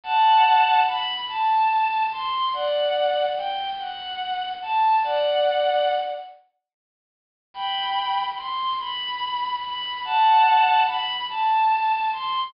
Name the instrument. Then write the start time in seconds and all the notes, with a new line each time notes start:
violin
0.03 F#5 A5
0.87 B5
1.28 A5
2.12 C6
2.53 D5 F#5
3.37 G5
3.79 F#5
4.62 A5
5.03 D5 F#5
7.54 G5 B5
8.37 C6
8.79 B5
9.62 B5
10.05 F#5 A5
10.86 B5
11.29 A5
12.13 C6